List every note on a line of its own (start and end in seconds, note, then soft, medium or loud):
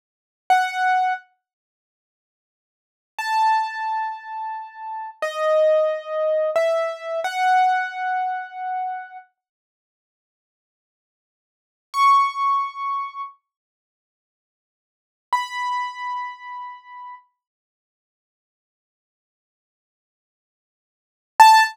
0.50 1.13 F#5 medium
3.19 5.10 A5 medium
5.22 6.50 D#5 medium
6.56 7.20 E5 medium
7.24 9.17 F#5 medium
11.94 13.21 C#6 medium
15.33 17.15 B5 medium
21.40 21.63 A5 loud